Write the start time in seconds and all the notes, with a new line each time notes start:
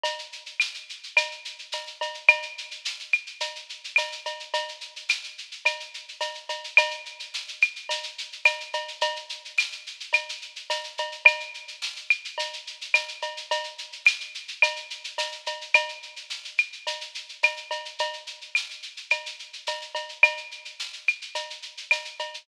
0.04 cowbell, shaker
0.19 shaker
0.32 shaker
0.46 shaker
0.60 tambourine, claves, shaker
0.74 shaker
0.89 shaker
1.03 shaker
1.17 cowbell, claves, shaker
1.31 shaker
1.45 shaker
1.59 shaker
1.72 tambourine, cowbell, shaker
1.87 shaker
2.01 cowbell, shaker
2.14 shaker
2.28 cowbell, claves, shaker
2.42 shaker
2.58 shaker
2.71 shaker
2.85 tambourine, shaker
3.00 shaker
3.12 claves, shaker
3.27 shaker
3.40 cowbell, shaker
3.55 shaker
3.69 shaker
3.84 shaker
3.96 tambourine, cowbell, claves, shaker
4.12 shaker
4.26 cowbell, shaker
4.40 shaker
4.54 cowbell, shaker
4.68 shaker
4.81 shaker
4.96 shaker
5.09 tambourine, claves, shaker
5.24 shaker
5.38 shaker
5.52 shaker
5.65 cowbell, claves, shaker
5.80 shaker
5.94 shaker
6.08 shaker
6.21 tambourine, cowbell, shaker
6.35 shaker
6.49 cowbell, shaker
6.64 shaker
6.77 cowbell, claves, shaker
6.91 shaker
7.05 shaker
7.20 shaker
7.34 tambourine, shaker
7.48 shaker
7.61 claves, shaker
7.76 shaker
7.89 cowbell, shaker
8.03 shaker
8.18 shaker
8.32 shaker
8.45 tambourine, cowbell, claves, shaker
8.60 shaker
8.73 cowbell, shaker
8.88 shaker
9.01 cowbell, shaker
9.16 shaker
9.29 shaker
9.45 shaker
9.58 tambourine, claves, shaker
9.72 shaker
9.86 shaker
10.00 shaker
10.13 cowbell, claves, shaker
10.29 shaker
10.42 shaker
10.56 shaker
10.70 tambourine, cowbell, shaker
10.84 shaker
10.98 cowbell, shaker
11.12 shaker
11.25 cowbell, claves, shaker
11.40 shaker
11.54 shaker
11.68 shaker
11.82 tambourine, shaker
11.96 shaker
12.10 claves, shaker
12.25 shaker
12.38 cowbell, shaker
12.53 shaker
12.67 shaker
12.81 shaker
12.94 tambourine, cowbell, claves, shaker
13.08 shaker
13.22 cowbell, shaker
13.37 shaker
13.51 cowbell, shaker
13.64 shaker
13.78 shaker
13.92 shaker
14.05 tambourine, claves, shaker
14.20 shaker
14.34 shaker
14.48 shaker
14.62 cowbell, claves, shaker
14.76 shaker
14.90 shaker
15.04 shaker
15.18 tambourine, cowbell, shaker
15.32 shaker
15.46 cowbell, shaker
15.61 shaker
15.74 cowbell, claves, shaker
15.89 shaker
16.02 shaker
16.16 shaker
16.30 tambourine, shaker
16.45 shaker
16.58 claves, shaker
16.73 shaker
16.87 cowbell, shaker
17.01 shaker
17.15 shaker
17.29 shaker
17.43 tambourine, cowbell, claves, shaker
17.57 shaker
17.71 cowbell, shaker
17.85 shaker
17.99 cowbell, shaker
18.13 shaker
18.27 shaker
18.41 shaker
18.55 tambourine, claves, shaker
18.70 shaker
18.82 shaker
18.97 shaker
19.10 cowbell, claves, shaker
19.26 shaker
19.39 shaker
19.53 shaker
19.67 tambourine, cowbell, shaker
19.81 shaker
19.95 cowbell, shaker
20.09 shaker
20.23 cowbell, claves, shaker
20.37 shaker
20.51 shaker
20.65 shaker
20.80 tambourine, shaker
20.93 shaker
21.07 claves, shaker
21.22 shaker
21.35 cowbell, shaker
21.50 shaker
21.62 shaker
21.77 shaker
21.91 tambourine, cowbell, claves, shaker
22.05 shaker
22.19 cowbell, shaker
22.34 shaker